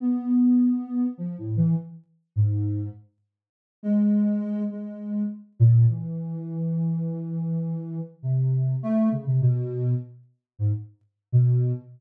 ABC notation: X:1
M:5/4
L:1/16
Q:1/4=102
K:none
V:1 name="Ocarina"
B,8 (3F,2 A,,2 E,2 z4 ^G,,4 | z6 ^G,6 G,4 z2 ^A,,2 | E,16 C,4 | A,2 ^C, =C, B,,4 z4 ^G,, z4 B,,3 |]